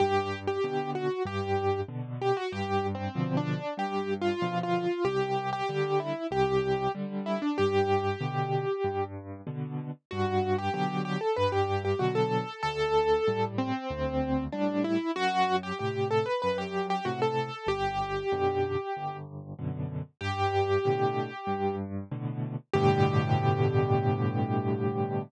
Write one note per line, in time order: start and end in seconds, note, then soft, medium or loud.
0.00 0.57 G2 medium
0.00 0.39 G4 loud
0.47 0.91 G4 medium
0.64 1.08 B2 medium
0.64 1.08 D3 medium
0.95 1.23 F#4 medium
1.25 1.82 G2 medium
1.25 1.81 G4 medium
1.88 2.33 B2 medium
1.88 2.33 D3 medium
2.22 2.37 G4 medium
2.37 2.52 F#4 medium
2.52 3.09 G2 medium
2.52 2.87 G4 medium
2.95 3.36 C4 medium
3.15 3.59 B2 medium
3.15 3.59 D3 medium
3.15 3.59 F3 medium
3.37 3.74 D4 medium
3.77 4.34 G2 medium
3.77 4.14 G4 medium
4.21 4.59 F4 medium
4.42 4.86 B2 medium
4.42 4.86 D3 medium
4.42 4.86 F3 medium
4.63 5.04 F4 medium
5.05 5.61 C2 medium
5.05 5.50 G4 medium
5.53 5.99 G4 medium
5.69 6.13 D3 medium
5.69 6.13 G3 medium
6.00 6.27 E4 medium
6.31 6.88 C2 loud
6.31 6.92 G4 medium
6.95 7.39 D3 medium
6.95 7.39 G3 medium
7.26 7.41 E4 medium
7.42 7.57 D4 medium
7.58 8.16 G2 medium
7.58 9.04 G4 medium
8.21 8.65 B2 medium
8.21 8.65 D3 medium
8.84 9.41 G2 medium
9.47 9.91 B2 medium
9.47 9.91 D3 medium
10.11 10.69 G2 medium
10.11 10.56 F#4 medium
10.58 10.73 G4 medium
10.74 11.18 B2 medium
10.74 11.18 D3 medium
10.74 11.18 F#3 medium
10.74 11.02 G4 medium
11.05 11.20 G4 medium
11.21 11.36 A4 medium
11.36 11.94 G2 loud
11.36 11.51 B4 medium
11.52 11.82 G4 medium
11.85 12.00 G4 medium
11.99 12.44 B2 medium
11.99 12.44 D3 medium
11.99 12.44 F#3 medium
11.99 12.14 F#4 medium
12.15 12.61 A4 medium
12.63 13.20 D2 medium
12.63 13.45 A4 loud
13.28 13.72 A2 medium
13.28 13.72 G3 medium
13.58 14.44 C4 medium
13.90 14.47 D2 medium
14.52 14.98 A2 medium
14.52 14.98 G3 medium
14.52 14.83 D4 medium
14.84 15.11 E4 medium
15.16 15.72 F#2 medium
15.16 15.56 F#4 loud
15.63 15.78 G4 medium
15.79 16.25 A2 medium
15.79 16.25 C3 medium
15.79 16.08 G4 medium
16.11 16.26 A4 medium
16.26 16.41 B4 medium
16.42 17.00 F#2 medium
16.42 16.57 B4 medium
16.58 16.86 G4 medium
16.90 17.05 G4 medium
17.05 17.50 A2 medium
17.05 17.50 C3 medium
17.05 17.20 F#4 medium
17.22 17.68 A4 medium
17.66 18.23 G1 medium
17.66 19.17 G4 medium
18.32 18.76 F#2 medium
18.32 18.76 B2 medium
18.32 18.76 D3 medium
18.97 19.54 G1 loud
19.59 20.03 F#2 medium
19.59 20.03 B2 medium
19.59 20.03 D3 medium
20.21 20.78 G2 loud
20.21 21.75 G4 loud
20.85 21.29 A2 medium
20.85 21.29 B2 medium
20.85 21.29 D3 medium
21.47 22.04 G2 medium
22.11 22.56 A2 medium
22.11 22.56 B2 medium
22.11 22.56 D3 medium
22.74 25.23 G2 loud
22.74 25.23 A2 loud
22.74 25.23 B2 loud
22.74 25.23 D3 loud
22.74 25.22 G4 loud